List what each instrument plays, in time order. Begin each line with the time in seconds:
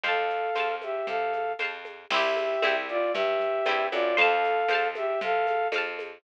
0.03 electric bass (finger) F2, flute A4 F5, orchestral harp C5 F5, low conga, shaker
0.08 orchestral harp A5
0.30 shaker
0.55 electric bass (finger) F2, orchestral harp C5 F5, tambourine, high conga, shaker
0.60 orchestral harp A5
0.82 flute G4 E5, high conga, shaker
1.07 electric bass (finger) C3, flute A4 F5, low conga, shaker
1.33 high conga, shaker
1.59 electric bass (finger) F2, orchestral harp C5 F5, tambourine, high conga, shaker
1.64 orchestral harp A5
1.85 high conga, shaker
2.10 electric bass (finger) C2, orchestral harp C4 E4, flute G4 E5, crash, low conga, shaker
2.16 orchestral harp G4
2.37 high conga, shaker
2.62 electric bass (finger) C2, orchestral harp C4 E4, tambourine, high conga, shaker
2.67 orchestral harp G4
2.88 flute F4 D5, shaker
3.13 electric bass (finger) G2, flute G4 E5, low conga, shaker
3.40 low conga, shaker
3.66 electric bass (finger) G2, orchestral harp C4 E4, tambourine, high conga, shaker
3.71 orchestral harp G4
3.92 electric bass (finger) F#2, flute F4 D5, high conga, shaker
4.17 electric bass (finger) F2, flute A4 F5, orchestral harp C5 F5, low conga, shaker
4.21 orchestral harp A5
4.44 shaker
4.68 electric bass (finger) F2, orchestral harp C5, tambourine, high conga, shaker
4.73 orchestral harp F5 A5
4.95 flute G4 E5, high conga, shaker
5.21 electric bass (finger) C3, flute A4 F5, low conga, shaker
5.47 high conga, shaker
5.72 electric bass (finger) F2, orchestral harp C5 F5, tambourine, high conga, shaker
5.78 orchestral harp A5
5.99 high conga, shaker